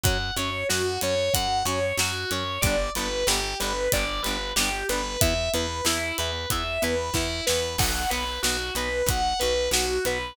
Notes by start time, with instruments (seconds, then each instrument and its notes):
0.03 electric bass (finger) F#2, acoustic guitar (steel) F#3 C#4, distortion guitar F#5, kick, closed hi-hat
0.36 electric bass (finger) F#2, acoustic guitar (steel) F#3 C#4, distortion guitar C#5, closed hi-hat
0.69 electric bass (finger) F#2, acoustic guitar (steel) F#3 C#4, distortion guitar F#4, snare
1.01 electric bass (finger) F#2, acoustic guitar (steel) F#3 C#4, distortion guitar C#5, closed hi-hat
1.34 electric bass (finger) F#2, acoustic guitar (steel) F#3 C#4, distortion guitar F#5, kick, closed hi-hat
1.65 electric bass (finger) F#2, acoustic guitar (steel) F#3 C#4, distortion guitar C#5, closed hi-hat
1.97 electric bass (finger) F#2, acoustic guitar (steel) F#3 C#4, distortion guitar F#4, snare
2.31 electric bass (finger) F#2, acoustic guitar (steel) F#3 C#4, distortion guitar C#5, closed hi-hat
2.61 electric bass (finger) G1, acoustic guitar (steel) G3, distortion guitar D5, kick, closed hi-hat
2.65 acoustic guitar (steel) B3 D4
2.95 electric bass (finger) G1, acoustic guitar (steel) G3 B3 D4, distortion guitar B4, closed hi-hat
3.27 electric bass (finger) G1, acoustic guitar (steel) G3 B3, distortion guitar G4, snare
3.31 acoustic guitar (steel) D4
3.60 electric bass (finger) G1, acoustic guitar (steel) G3 B3 D4, distortion guitar B4, closed hi-hat
3.92 electric bass (finger) G1, acoustic guitar (steel) G3 B3 D4, distortion guitar D5, kick, closed hi-hat
4.22 electric bass (finger) G1, acoustic guitar (steel) G3 B3, distortion guitar B4, closed hi-hat
4.28 acoustic guitar (steel) D4
4.56 electric bass (finger) G1, acoustic guitar (steel) G3 B3, distortion guitar G4, snare
4.60 acoustic guitar (steel) D4
4.89 electric bass (finger) G1, acoustic guitar (steel) G3 B3 D4, distortion guitar B4, closed hi-hat
5.21 electric bass (finger) E2, acoustic guitar (steel) B3 E4, distortion guitar E5, kick, closed hi-hat
5.53 electric bass (finger) E2, acoustic guitar (steel) B3 E4, distortion guitar B4, closed hi-hat
5.85 electric bass (finger) E2, acoustic guitar (steel) B3 E4, distortion guitar E4, snare
6.18 electric bass (finger) E2, acoustic guitar (steel) B3 E4, distortion guitar B4, closed hi-hat
6.50 electric bass (finger) E2, acoustic guitar (steel) B3 E4, distortion guitar E5, kick, closed hi-hat
6.82 electric bass (finger) E2, acoustic guitar (steel) B3 E4, distortion guitar B4, closed hi-hat
7.14 electric bass (finger) E2, acoustic guitar (steel) B3 E4, distortion guitar E4, kick, snare
7.47 electric bass (finger) E2, acoustic guitar (steel) B3 E4, distortion guitar B4, snare
7.78 electric bass (finger) B1, acoustic guitar (steel) B3 F#4, distortion guitar F#5, kick, crash
8.10 electric bass (finger) B1, acoustic guitar (steel) B3 F#4, distortion guitar B4, closed hi-hat
8.43 electric bass (finger) B1, acoustic guitar (steel) B3 F#4, distortion guitar F#4, snare
8.75 electric bass (finger) B1, acoustic guitar (steel) B3 F#4, distortion guitar B4, closed hi-hat
9.06 electric bass (finger) B1, acoustic guitar (steel) B3 F#4, distortion guitar F#5, kick, closed hi-hat
9.39 electric bass (finger) B1, acoustic guitar (steel) B3 F#4, distortion guitar B4, closed hi-hat
9.71 electric bass (finger) B1, acoustic guitar (steel) B3 F#4, distortion guitar F#4, snare
10.05 electric bass (finger) B1, acoustic guitar (steel) B3 F#4, distortion guitar B4, closed hi-hat